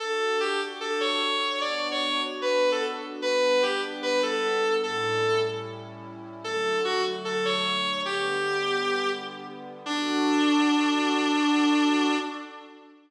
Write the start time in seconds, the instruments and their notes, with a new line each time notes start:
0.00 pad 2 (warm) D4 F#4 A4, clarinet A4
0.40 clarinet G4
0.81 clarinet A4
1.01 clarinet C#5
1.61 pad 2 (warm) B3 D4 F#4, clarinet D5
1.91 clarinet C#5
2.42 clarinet B4
2.72 clarinet A4
3.22 pad 2 (warm) G3 B3 D4, clarinet B4
3.62 clarinet G4
4.03 clarinet B4
4.23 clarinet A4
4.83 pad 2 (warm) A2 G3 C#4 E4, clarinet A4
6.44 pad 2 (warm) D3 F#3 A3, clarinet A4
6.85 clarinet F#4
7.25 clarinet A4
7.45 clarinet C#5
8.05 pad 2 (warm) D3 G3 B3, clarinet G4
9.86 clarinet D4, pad 2 (warm) D4 F#4 A4